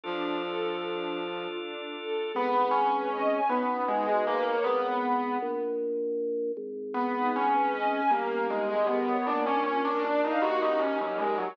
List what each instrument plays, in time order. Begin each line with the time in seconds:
0.04 flute F3, string ensemble 1 D4, drawbar organ D4 F4 A4
0.42 string ensemble 1 A4
0.81 string ensemble 1 D4
1.19 string ensemble 1 F4
1.57 string ensemble 1 D4
1.96 string ensemble 1 A4
2.34 drawbar organ G#1, string ensemble 1 B3, acoustic grand piano B3
2.54 string ensemble 1 D#4
2.71 acoustic grand piano C#4, string ensemble 1 G#4
2.92 string ensemble 1 B4
3.11 string ensemble 1 D#5
3.31 string ensemble 1 G#5
3.49 drawbar organ B1, acoustic grand piano B3, string ensemble 1 B3
3.69 string ensemble 1 C#4
3.88 acoustic grand piano G#3, string ensemble 1 D#4
4.06 acoustic grand piano G#3, string ensemble 1 F#4
4.27 acoustic grand piano A#3, string ensemble 1 B4
4.46 string ensemble 1 C#5
4.64 drawbar organ G#1, acoustic grand piano B3
5.42 drawbar organ A#1
6.57 drawbar organ G#1
6.94 acoustic grand piano B3, string ensemble 1 B3
7.15 string ensemble 1 D#4
7.34 acoustic grand piano C#4, string ensemble 1 G#4
7.54 string ensemble 1 B4
7.73 string ensemble 1 D#5
7.92 string ensemble 1 G#5
8.11 drawbar organ G1, acoustic grand piano A#3, string ensemble 1 A#3
8.30 string ensemble 1 C#4
8.50 acoustic grand piano G#3, string ensemble 1 D#4
8.69 acoustic grand piano G#3, string ensemble 1 G4
8.87 acoustic grand piano B3, string ensemble 1 A#4
9.07 string ensemble 1 C#5
9.26 drawbar organ A#1, string ensemble 1 A#3, acoustic grand piano D4
9.46 acoustic grand piano C#4, string ensemble 1 D4
9.64 acoustic grand piano C#4, string ensemble 1 F4
9.84 acoustic grand piano D4, string ensemble 1 A#4
10.03 acoustic grand piano D4, string ensemble 1 D5
10.23 acoustic grand piano D#4, string ensemble 1 F5
10.42 drawbar organ D#2, string ensemble 1 A#3, acoustic grand piano F#4
10.61 string ensemble 1 C#4, acoustic grand piano D#4
10.79 acoustic grand piano C#4, string ensemble 1 D#4
11.00 acoustic grand piano F#3, string ensemble 1 G4
11.18 acoustic grand piano G#3, string ensemble 1 A#4
11.38 acoustic grand piano F#3, string ensemble 1 C#5